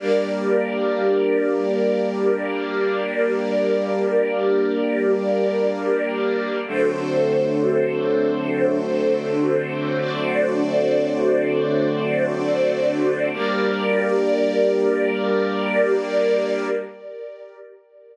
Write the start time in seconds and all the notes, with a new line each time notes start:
0.00 G3 A#3 D4 G4 A#4 D5
6.67 D3 F#3 A3 C4 D4 F#4 A4 C5
9.99 D4 F#4 C5 D5
13.33 G3 A#3 D4 G4 A#4 D5